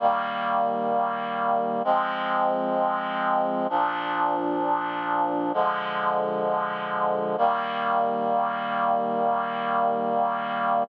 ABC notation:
X:1
M:4/4
L:1/8
Q:1/4=65
K:Eb
V:1 name="Clarinet"
[E,G,B,]4 [F,A,C]4 | [B,,F,D]4 [D,F,A,]4 | [E,G,B,]8 |]